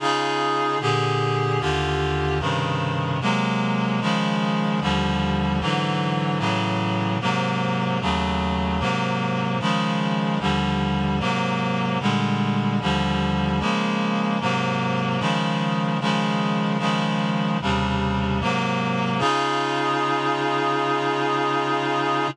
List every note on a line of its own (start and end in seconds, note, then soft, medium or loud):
0.00 0.79 C#3 medium
0.00 0.79 D#4 medium
0.00 0.79 F4 medium
0.00 0.79 G#4 loud
0.81 1.60 A#2 medium
0.81 1.59 D3 medium
0.81 1.59 G4 medium
0.81 1.60 G#4 loud
1.60 2.39 D#2 medium
1.60 2.39 D3 medium
1.60 2.39 F4 medium
1.60 2.39 G4 medium
2.40 3.19 G2 medium
2.40 3.19 C3 medium
2.40 3.19 C#3 medium
2.40 3.19 D#3 medium
3.21 4.00 C3 medium
3.21 4.00 F#3 medium
3.21 4.00 G#3 medium
3.21 4.00 A#3 medium
4.01 4.80 C#3 medium
4.01 4.80 D#3 medium
4.01 4.80 F3 medium
4.01 4.80 G#3 loud
4.81 5.60 D#2 loud
4.81 5.60 D3 medium
4.81 5.60 F3 medium
4.81 5.60 G3 medium
5.61 6.40 G#2 medium
5.61 6.40 D3 medium
5.61 6.38 E3 loud
5.61 6.38 F#3 medium
6.39 7.18 A2 medium
6.39 7.18 C#3 medium
6.39 7.18 E3 medium
6.39 7.18 F#3 medium
7.21 8.00 G#2 medium
7.21 8.00 C3 medium
7.21 8.00 F#3 medium
7.21 8.00 A#3 medium
8.01 8.80 D#2 medium
8.01 8.80 C#3 medium
8.01 8.79 F#3 medium
8.01 8.80 A3 medium
8.80 9.59 G#2 medium
8.80 9.59 C3 medium
8.80 9.59 F#3 medium
8.80 9.59 A#3 medium
9.60 10.39 C#3 medium
9.60 10.39 D#3 medium
9.60 10.39 F3 medium
9.60 10.39 G#3 medium
10.40 11.19 D#2 medium
10.40 11.19 D3 medium
10.40 11.19 F3 medium
10.40 11.19 G3 medium
11.20 11.99 G#2 medium
11.20 11.99 C3 medium
11.20 11.99 F#3 medium
11.20 11.99 A#3 medium
12.01 12.80 A#2 medium
12.01 12.80 D3 medium
12.01 12.80 G3 medium
12.01 12.80 G#3 medium
12.81 13.60 D#2 medium
12.81 13.60 D3 medium
12.81 13.59 F3 loud
12.81 13.60 G3 medium
13.60 14.39 C#3 medium
13.60 14.39 F3 medium
13.60 14.39 G#3 loud
13.60 14.39 A#3 medium
14.41 15.20 G#2 loud
14.41 15.20 C3 medium
14.41 15.20 F#3 medium
14.41 15.20 A#3 medium
15.20 15.99 C#3 medium
15.20 15.99 D#3 medium
15.20 15.99 F3 medium
15.20 15.99 G#3 medium
16.01 16.78 C#3 medium
16.01 16.78 D#3 medium
16.01 16.78 F3 medium
16.01 16.78 G#3 loud
16.79 17.58 C#3 medium
16.79 17.58 D#3 medium
16.79 17.58 F3 medium
16.79 17.58 G#3 medium
17.61 18.40 D#2 medium
17.61 18.40 C3 medium
17.61 18.40 C#3 medium
17.61 18.40 G3 medium
18.41 19.20 G#2 medium
18.41 19.20 C3 medium
18.41 19.20 F#3 medium
18.41 19.20 A#3 loud
19.19 22.28 C#3 loud
19.19 22.28 D#4 loud
19.19 22.28 F4 loud
19.19 22.28 G#4 loud